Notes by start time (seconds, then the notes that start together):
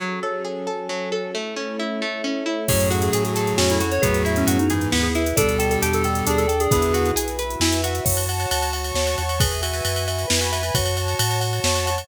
0.00 F#3 C#4 F#4 G#4 A4
0.23 A4 C#5
0.45 G#4 G#5
0.67 F#3 C#4 F#4 A4 A5
0.89 F#3 F#4
1.12 A4 C#5
1.34 A3 C#4 E4 A4
1.56 C#4 C#5
1.79 E4 E5
2.01 A3 E4 A4
2.24 C#4 C#5
2.46 E4 E5
2.68 F#2 A2 F#3 C#4 F#4 G#4 A4 C#5, kick, crash
2.80 closed hi-hat
2.90 F#4 F#5, closed hi-hat
3.02 G#4, closed hi-hat
3.13 A2 G#4 G#5, closed hi-hat
3.24 G#4, closed hi-hat
3.35 C#4 F#4 A4 C#5 A5, closed hi-hat
3.47 closed hi-hat
3.57 F2 C#4 F#4 G#5, snare
3.70 E4, closed hi-hat
3.80 F#4 F#5, closed hi-hat
3.92 C#5, closed hi-hat
4.02 E2 A2 F#3 B3 E4 F#4 G#4 B4, kick, closed hi-hat
4.14 closed hi-hat
4.25 E4 E5, closed hi-hat
4.36 C#4, closed hi-hat
4.47 F#2 F#4 F#5, closed hi-hat
4.59 D#4, closed hi-hat
4.70 G#2 E3 B3 E4 G#4 B4 G#5, closed hi-hat
4.81 closed hi-hat
4.92 D#2 B3 E4 F#5, snare
5.03 G#4
5.15 E4 E5, closed hi-hat
5.26 closed hi-hat
5.36 D2 B2 G3 D4 G4 A4 D5, kick, closed hi-hat
5.49 closed hi-hat
5.59 A4 G5, closed hi-hat
5.70 A4, closed hi-hat
5.82 E2 G4 A5, closed hi-hat
5.93 A4, closed hi-hat
6.04 D4 A4 D5 G5, closed hi-hat
6.15 closed hi-hat
6.27 D#2 D4 G#4 D5, closed hi-hat
6.38 A4, closed hi-hat
6.48 A4 G5, closed hi-hat
6.60 G#4, closed hi-hat
6.71 E2 D3 B3 E4 F#4 G#4 B4 E5, kick, closed hi-hat
6.82 closed hi-hat
6.94 F#4 F#5, closed hi-hat
7.05 closed hi-hat
7.16 B1 G#4 G#5, closed hi-hat
7.28 closed hi-hat
7.39 E4 F#4 B4 E5 B5, closed hi-hat
7.50 closed hi-hat
7.60 F2 E4 G#5, snare
7.72 closed hi-hat
7.84 F#4 F#5, closed hi-hat
7.95 closed hi-hat
8.05 F#2 F#4 C#5 F#5 A5, kick, crash
8.17 ride
8.29 F#5, ride
8.40 ride
8.51 D2 A5, ride
8.62 ride
8.73 C#5 F#5 A5 C#6, ride
8.84 ride
8.94 D#2 C#5, snare
9.07 ride
9.18 E2 F#5, ride
9.29 ride
9.39 G#4 B4 E5 G#5, kick, ride
9.52 ride
9.63 F#4 E5, ride
9.74 ride
9.84 F#2 G#5, ride
9.96 ride
10.08 B4 E5 G#5 B5, ride
10.19 ride
10.28 F2 E4 B4, snare
10.41 F#4, ride
10.52 F#4 E5, ride
10.63 ride
10.74 F#2 F#4 C#5 F#5 A5, kick, ride
10.86 ride
10.97 F#5, ride
11.08 ride
11.19 A2 A5, ride
11.31 ride
11.40 C#5 F#5 A5 C#6, ride
11.53 ride
11.64 F2 C#5, snare
11.75 ride
11.86 F#5, ride
11.98 ride